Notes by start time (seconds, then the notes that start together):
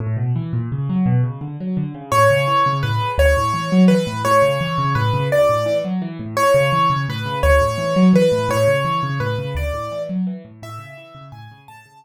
0.00 A2
0.17 B2
0.36 E3
0.53 A#2
0.72 C#3
0.89 F#3
1.06 B2
1.23 C#3
1.41 D3
1.60 F#3
1.77 D3
1.94 C#3
2.12 A2 C#5
2.30 C#3
2.47 E3
2.66 C#3
2.83 A2 B4
3.01 C#3
3.18 D2 C#5
3.37 A2
3.54 E3
3.72 F#3
3.88 E3 B4
4.07 A2
4.25 A2 C#5
4.42 C#3
4.61 E3
4.78 C#3
4.95 A2 B4
5.13 C#3
5.31 D2 D5
5.49 A2
5.66 E3
5.85 F#3
6.02 E3
6.19 A2
6.37 A2 C#5
6.54 C#3
6.72 E3
6.90 C#3
7.08 A2 B4
7.25 C#3
7.43 D2 C#5
7.61 A2
7.78 E3
7.96 F#3
8.13 E3 B4
8.32 A2
8.49 A2 C#5
8.68 C#3
8.85 E3
9.03 C#3
9.20 A2 B4
9.38 C#3
9.55 D2 D5
9.74 A2
9.91 E3
10.09 F#3
10.27 E3
10.45 A2
10.62 A2 E5
10.79 C#3
10.97 E3
11.15 C#3
11.32 A2 G#5
11.51 C#3
11.68 A2 A5
11.86 C#3
12.04 E3